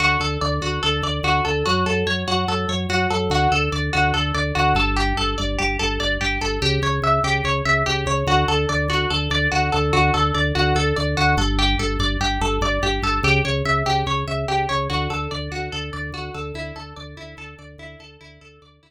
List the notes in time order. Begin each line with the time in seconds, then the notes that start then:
0.00 D2 F#4
0.20 D2 A4
0.41 D2 D5
0.61 D2 F#4
0.83 D2 A4
1.02 D2 D5
1.23 D2 F#4
1.45 D2 A4
1.66 F#2 F#4
1.86 F#2 A4
2.07 F#2 C#5
2.27 F#2 F#4
2.48 F#2 A4
2.69 F#2 C#5
2.89 F#2 F#4
3.10 F#2 A4
3.30 D2 F#4
3.52 D2 A4
3.72 D2 D5
3.93 D2 F#4
4.14 D2 A4
4.34 D2 D5
4.55 D2 F#4
4.75 G1 A4
4.96 G4
5.17 G1 A4
5.38 G1 D5
5.59 G1 G4
5.79 G1 A4
6.00 G1 D5
6.21 G1 G4
6.41 G1 A4
6.62 C#2 G4
6.82 C#2 C#5
7.02 C#2 E5
7.24 C#2 G4
7.44 C#2 C#5
7.65 C#2 E5
7.86 C#2 G4
8.06 C#2 C#5
8.27 D2 F#4
8.48 D2 A4
8.69 D2 D5
8.88 D2 F#4
9.10 D2 A4
9.30 D2 D5
9.52 D2 F#4
9.72 D2 A4
9.93 D2 F#4
10.14 D2 A4
10.34 D2 D5
10.55 D2 F#4
10.75 D2 A4
10.96 D2 D5
11.17 D2 F#4
11.37 G1 A4
11.59 G4
11.79 G1 A4
11.99 G1 D5
12.21 G1 G4
12.41 G1 A4
12.61 G1 D5
12.82 G1 G4
13.02 G1 A4
13.23 C#2 G4
13.45 C#2 C#5
13.65 C#2 E5
13.86 C#2 G4
14.06 C#2 C#5
14.28 C#2 E5
14.48 C#2 G4
14.69 C#2 C#5
14.90 D2 F#4
15.10 D2 A4
15.31 D2 D5
15.51 D2 F#4
15.72 D2 A4
15.93 D2 D5
16.12 D2 F#4
16.34 D2 A4
16.54 D2 E4
16.76 D2 A4
16.96 D2 D5
17.17 D2 E4
17.37 D2 A4
17.58 D2 D5
17.78 D2 E4
17.99 D2 A4
18.21 D2 E4
18.41 D2 A4
18.62 D2 D5
18.83 D2 E4